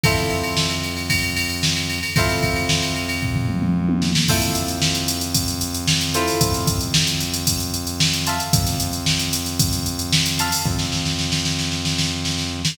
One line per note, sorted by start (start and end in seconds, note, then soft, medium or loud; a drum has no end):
0.04 1.99 F2 medium
0.04 2.12 E4 medium
0.04 2.12 F4 medium
0.04 2.12 A4 medium
0.04 2.12 C5 medium
0.04 kick loud
0.04 ride loud
0.17 snare medium
0.17 ride medium
0.30 ride medium
0.43 ride medium
0.57 snare loud
0.70 ride medium
0.83 ride medium
0.97 ride medium
1.10 kick medium
1.10 ride loud
1.23 ride medium
1.37 ride medium
1.50 ride medium
1.63 snare loud
1.76 snare soft
1.76 ride medium
1.89 ride medium
2.03 ride medium
2.16 4.11 F2 loud
2.16 4.25 E4 loud
2.16 4.25 F4 loud
2.16 4.25 A4 medium
2.16 4.25 C5 medium
2.16 kick loud
2.16 ride loud
2.29 snare medium
2.29 ride medium
2.43 kick medium
2.43 ride medium
2.56 ride medium
2.69 snare loud
2.82 ride medium
2.96 ride medium
3.09 ride medium
3.22 kick medium
3.22 floor tom medium
3.35 floor tom medium
3.49 mid tom medium
3.62 mid tom medium
3.89 high tom medium
4.02 snare medium
4.15 snare loud
4.28 6.24 F2 loud
4.28 6.05 E4 medium
4.28 6.05 F4 medium
4.28 6.05 A4 medium
4.28 6.05 C5 medium
4.28 kick loud
4.28 crash loud
4.42 snare medium
4.42 closed hi-hat medium
4.55 closed hi-hat medium
4.68 closed hi-hat medium
4.82 snare loud
4.95 closed hi-hat medium
5.08 closed hi-hat medium
5.21 closed hi-hat medium
5.35 kick medium
5.35 closed hi-hat loud
5.48 closed hi-hat medium
5.61 closed hi-hat medium
5.74 closed hi-hat medium
5.87 snare loud
6.01 closed hi-hat medium
6.14 8.16 E4 medium
6.14 8.16 F4 medium
6.14 8.16 A4 medium
6.14 8.16 C5 medium
6.14 closed hi-hat medium
6.27 open hi-hat medium
6.41 8.36 F2 medium
6.41 kick loud
6.41 closed hi-hat loud
6.54 snare medium
6.54 closed hi-hat medium
6.67 kick medium
6.67 closed hi-hat medium
6.81 closed hi-hat medium
6.94 snare loud
7.07 closed hi-hat medium
7.20 closed hi-hat medium
7.34 closed hi-hat medium
7.47 kick medium
7.47 closed hi-hat loud
7.60 closed hi-hat medium
7.74 closed hi-hat medium
7.87 closed hi-hat medium
8.00 snare loud
8.13 closed hi-hat medium
8.27 10.28 E5 medium
8.27 10.28 F5 medium
8.27 10.28 A5 medium
8.27 10.28 C6 medium
8.27 snare soft
8.27 closed hi-hat medium
8.40 closed hi-hat medium
8.53 10.48 F2 loud
8.53 kick loud
8.53 closed hi-hat loud
8.66 snare medium
8.66 closed hi-hat medium
8.80 closed hi-hat medium
8.93 closed hi-hat medium
9.06 snare loud
9.19 closed hi-hat medium
9.33 closed hi-hat medium
9.46 snare soft
9.46 closed hi-hat medium
9.60 kick loud
9.60 closed hi-hat loud
9.73 snare soft
9.73 closed hi-hat medium
9.86 closed hi-hat medium
9.99 closed hi-hat medium
10.12 snare loud
10.26 closed hi-hat medium
10.39 12.74 E5 medium
10.39 12.74 F5 medium
10.39 12.74 A5 medium
10.39 12.74 C6 medium
10.39 closed hi-hat medium
10.52 open hi-hat medium
10.65 12.61 F2 loud
10.65 kick medium
10.79 snare medium
10.92 snare medium
11.06 snare medium
11.19 snare medium
11.32 snare medium
11.45 snare medium
11.59 snare medium
11.72 snare medium
11.85 snare medium
11.98 snare medium
12.25 snare medium
12.38 snare medium
12.65 snare loud